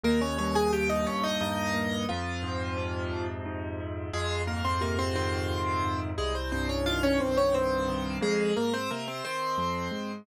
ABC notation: X:1
M:3/4
L:1/16
Q:1/4=88
K:Fm
V:1 name="Acoustic Grand Piano"
[B,B] [Dd] [Dd] [Aa] [Gg] [Ee] [Dd] [Ee] [Ee]4 | [F,F]8 z4 | [A,A]2 [B,B] [Cc] [B,B] [Cc] [Cc]6 | [A,A] [Cc] [Cc] [Dd] [Ff] [Dd] [Cc] [Dd] [Cc]4 |
[A,A]2 [B,B] [Cc] [B,B] [Cc] [Cc]6 |]
V:2 name="Acoustic Grand Piano" clef=bass
E,,2 G,,2 B,,2 E,,2 G,,2 B,,2 | F,,2 A,,2 C,2 F,,2 A,,2 C,2 | F,,2 A,,2 C,2 E,2 F,,2 A,,2 | C,,2 G,,2 E,2 C,,2 G,,2 E,2 |
F,,2 A,,2 C,2 E,2 F,,2 A,,2 |]